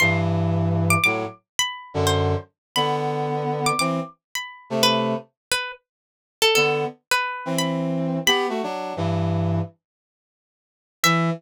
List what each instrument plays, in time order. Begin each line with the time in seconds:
0.00 brass section G2 E3, pizzicato strings C6
0.90 pizzicato strings D6
1.04 brass section A2 F#3, pizzicato strings D6
1.59 pizzicato strings B5
1.94 brass section F#2 D3
2.07 pizzicato strings C5
2.76 brass section D3 B3, pizzicato strings B5
3.66 pizzicato strings D6
3.79 brass section E3 C4, pizzicato strings D6
4.35 pizzicato strings B5
4.70 brass section C3 A3
4.83 pizzicato strings B4
5.52 pizzicato strings B4
6.42 pizzicato strings A4
6.55 brass section D3 B3, pizzicato strings A4
7.11 pizzicato strings B4
7.45 brass section E3 C4
7.58 pizzicato strings B5
8.26 brass section B3 G4, pizzicato strings B5
8.49 brass section A3 F#4
8.63 brass section F#3 D4
8.96 brass section G2 E3
11.04 brass section E3, pizzicato strings E5